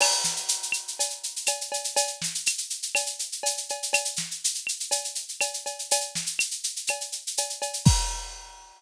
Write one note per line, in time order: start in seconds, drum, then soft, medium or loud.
0.01 crash loud
0.01 cowbell loud
0.01 claves loud
0.12 shaker medium
0.24 snare medium
0.24 shaker loud
0.36 shaker medium
0.48 shaker loud
0.63 shaker medium
0.72 claves loud
0.72 shaker medium
0.88 shaker medium
0.99 cowbell medium
0.99 shaker loud
1.10 shaker medium
1.23 shaker medium
1.36 shaker medium
1.46 cowbell medium
1.46 claves medium
1.46 shaker loud
1.61 shaker medium
1.72 cowbell medium
1.72 shaker medium
1.84 shaker medium
1.96 cowbell loud
1.96 shaker loud
2.07 shaker medium
2.22 snare medium
2.22 shaker medium
2.35 shaker medium
2.46 claves loud
2.46 shaker loud
2.58 shaker medium
2.70 shaker medium
2.82 shaker medium
2.95 cowbell medium
2.95 claves loud
2.95 shaker loud
3.06 shaker medium
3.19 shaker medium
3.32 shaker medium
3.43 cowbell loud
3.43 shaker loud
3.57 shaker medium
3.69 cowbell medium
3.69 shaker medium
3.83 shaker medium
3.93 cowbell loud
3.93 claves loud
3.93 shaker loud
4.05 shaker medium
4.16 snare medium
4.16 shaker medium
4.31 shaker medium
4.44 shaker loud
4.55 shaker medium
4.67 claves medium
4.67 shaker medium
4.80 shaker medium
4.91 cowbell medium
4.91 shaker loud
5.04 shaker medium
5.15 shaker medium
5.29 shaker medium
5.41 cowbell medium
5.41 claves loud
5.41 shaker loud
5.54 shaker medium
5.66 cowbell medium
5.66 shaker medium
5.79 shaker medium
5.91 cowbell loud
5.91 shaker loud
6.01 shaker medium
6.15 snare medium
6.15 shaker medium
6.26 shaker medium
6.39 claves loud
6.39 shaker loud
6.51 shaker medium
6.64 shaker loud
6.76 shaker medium
6.87 cowbell medium
6.87 claves loud
6.87 shaker loud
7.01 shaker medium
7.12 shaker medium
7.27 shaker medium
7.37 cowbell medium
7.37 shaker loud
7.50 shaker medium
7.62 cowbell medium
7.62 shaker medium
7.73 shaker medium
7.85 kick loud
7.85 crash loud